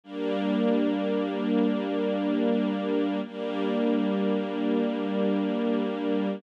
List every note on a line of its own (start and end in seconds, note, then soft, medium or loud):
0.04 3.21 G3 medium
0.04 3.21 A#3 medium
0.04 3.21 D4 medium
3.25 6.41 G3 medium
3.25 6.41 A#3 medium
3.25 6.41 D4 medium